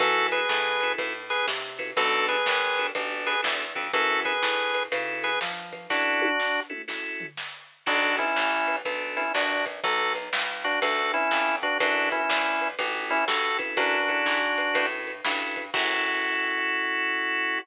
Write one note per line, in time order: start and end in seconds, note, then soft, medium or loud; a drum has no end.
0.00 0.46 F#2 loud
0.00 0.41 C#4 medium
0.00 0.41 E4 medium
0.00 0.27 F#4 loud
0.00 0.41 F#4 medium
0.00 0.27 A4 loud
0.00 0.41 A4 loud
0.00 kick loud
0.00 ride medium
0.32 0.93 G#4 medium
0.32 0.93 B4 medium
0.32 ride medium
0.49 0.95 A2 medium
0.49 snare medium
0.80 1.13 C#4 medium
0.80 1.13 E4 medium
0.80 1.13 F#4 medium
0.80 1.13 A4 medium
0.80 ride medium
0.98 1.44 A2 medium
0.98 kick medium
0.98 ride medium
1.30 1.46 G#4 medium
1.30 1.46 B4 loud
1.30 ride medium
1.48 1.93 C3 medium
1.48 snare medium
1.78 1.91 C#4 medium
1.78 1.91 E4 medium
1.78 1.91 F#4 medium
1.78 1.91 A4 medium
1.78 kick medium
1.78 ride medium
1.97 2.42 B1 medium
1.97 2.36 B3 medium
1.97 2.36 D4 medium
1.97 2.27 F#4 medium
1.97 2.36 F#4 medium
1.97 2.27 A4 loud
1.97 2.36 A4 medium
1.97 kick medium
1.97 ride medium
2.28 2.87 G#4 medium
2.28 2.87 B4 medium
2.28 ride medium
2.46 2.92 G#1 medium
2.46 snare medium
2.77 2.91 B3 medium
2.77 2.91 D4 medium
2.77 2.91 F#4 medium
2.77 2.91 A4 medium
2.77 ride medium
2.95 3.41 A1 medium
2.95 3.34 B3 medium
2.95 3.34 D4 medium
2.95 3.34 F#4 medium
2.95 3.34 A4 medium
2.95 kick medium
2.95 ride medium
3.27 3.41 G#4 medium
3.27 3.41 B4 loud
3.27 ride medium
3.42 3.73 E2 medium
3.42 3.64 B3 medium
3.42 3.64 D4 medium
3.42 3.64 F#4 medium
3.42 3.64 A4 medium
3.42 snare loud
3.75 3.92 F2 medium
3.75 3.87 B3 medium
3.75 3.87 D4 medium
3.75 3.87 F#4 medium
3.75 3.87 A4 medium
3.75 kick medium
3.75 ride medium
3.93 4.39 F#2 medium
3.93 4.33 C#4 medium
3.93 4.33 E4 medium
3.93 4.20 F#4 medium
3.93 4.33 F#4 medium
3.93 4.20 A4 loud
3.93 4.33 A4 medium
3.93 kick medium
3.93 ride medium
4.25 4.83 G#4 medium
4.25 4.83 B4 medium
4.25 kick medium
4.25 ride medium
4.43 4.88 A2 medium
4.43 snare medium
4.74 ride medium
4.92 5.37 C#3 medium
4.92 5.31 C#4 medium
4.92 5.31 E4 medium
4.92 5.31 F#4 medium
4.92 5.31 A4 medium
4.92 kick medium
4.92 ride medium
5.23 5.39 G#4 medium
5.23 5.39 B4 medium
5.23 ride medium
5.41 5.87 F3 medium
5.41 snare medium
5.73 kick medium
5.73 ride medium
5.90 6.29 C#4 medium
5.90 6.60 D4 medium
5.90 6.29 E4 medium
5.90 6.29 F#4 medium
5.90 6.60 F#4 loud
5.90 6.29 A4 medium
5.90 kick medium
5.90 snare medium
6.22 high tom medium
6.39 snare medium
6.69 6.82 C#4 medium
6.69 6.82 E4 medium
6.69 6.82 F#4 medium
6.69 6.82 A4 medium
6.69 mid tom medium
6.88 7.26 C#4 medium
6.88 7.26 E4 medium
6.88 7.26 F#4 medium
6.88 7.26 A4 medium
6.88 snare medium
7.20 floor tom medium
7.37 snare medium
7.86 8.33 B1 medium
7.86 8.25 B3 medium
7.86 8.25 D4 medium
7.86 8.16 D4 medium
7.86 8.25 F#4 medium
7.86 8.16 F#4 loud
7.86 8.25 A4 medium
7.86 kick medium
7.86 crash medium
8.19 8.76 C#4 medium
8.19 8.76 E4 medium
8.19 kick medium
8.19 ride soft
8.36 8.82 A1 medium
8.36 snare medium
8.68 ride medium
8.85 9.31 B1 medium
8.85 9.24 B3 medium
8.85 9.24 D4 medium
8.85 9.24 F#4 medium
8.85 9.24 A4 medium
8.85 kick medium
8.85 ride medium
9.17 9.33 C#4 medium
9.17 9.33 E4 medium
9.17 ride medium
9.34 9.80 A#1 medium
9.34 9.65 D4 medium
9.34 9.65 F#4 medium
9.34 snare medium
9.66 kick medium
9.66 ride medium
9.84 10.29 B1 loud
9.84 10.13 F#4 medium
9.84 10.13 A4 medium
9.84 kick medium
9.84 ride medium
10.15 ride medium
10.33 10.78 C#2 medium
10.33 snare loud
10.64 10.80 D4 medium
10.64 10.80 F#4 loud
10.64 ride medium
10.82 11.28 D2 medium
10.82 11.12 F#4 medium
10.82 11.12 A4 medium
10.82 kick medium
10.82 ride medium
11.14 11.56 C#4 medium
11.14 11.56 E4 loud
11.14 ride medium
11.31 11.77 F2 medium
11.31 snare medium
11.62 11.78 D4 medium
11.62 11.78 F#4 loud
11.62 kick medium
11.62 ride medium
11.80 12.26 F#2 medium
11.80 12.19 C#4 medium
11.80 12.09 D4 medium
11.80 12.19 E4 medium
11.80 12.09 F#4 loud
11.80 12.19 F#4 medium
11.80 12.19 A4 medium
11.80 kick medium
11.80 ride medium
12.12 12.68 C#4 medium
12.12 12.68 E4 medium
12.12 kick medium
12.12 ride medium
12.30 12.75 D2 medium
12.30 snare medium
12.61 ride medium
12.79 13.24 A1 medium
12.79 13.17 C#4 medium
12.79 13.17 E4 medium
12.79 13.17 F#4 medium
12.79 13.17 A4 medium
12.79 kick medium
12.79 ride medium
13.10 13.25 C#4 medium
13.10 13.25 E4 loud
13.10 ride medium
13.28 13.74 G2 medium
13.28 13.58 F#4 medium
13.28 13.58 A4 medium
13.28 snare medium
13.58 13.98 C#4 medium
13.58 13.98 E4 medium
13.58 13.98 F#4 medium
13.58 13.98 A4 medium
13.58 kick medium
13.58 ride medium
13.77 14.23 F#2 medium
13.77 14.86 D4 medium
13.77 14.86 F#4 loud
13.77 kick medium
13.77 ride medium
14.08 14.39 C#4 medium
14.08 14.39 E4 medium
14.08 14.39 F#4 medium
14.08 14.39 A4 medium
14.08 kick medium
14.08 ride medium
14.26 14.72 G#2 medium
14.26 snare medium
14.58 ride medium
14.73 15.21 A2 medium
14.73 15.12 C#4 medium
14.73 15.12 E4 medium
14.73 15.12 F#4 medium
14.73 15.12 A4 medium
14.73 kick medium
14.73 ride medium
15.07 ride medium
15.25 15.70 G2 medium
15.25 15.63 C#4 medium
15.25 15.63 E4 medium
15.25 15.63 F#4 medium
15.25 15.63 A4 medium
15.25 snare loud
15.56 kick medium
15.56 ride medium
15.74 17.59 F#2 medium
15.74 17.59 C#4 loud
15.74 17.59 E4 loud
15.74 17.59 F#4 loud
15.74 17.59 F#4 medium
15.74 17.59 A4 medium
15.74 kick loud
15.74 crash loud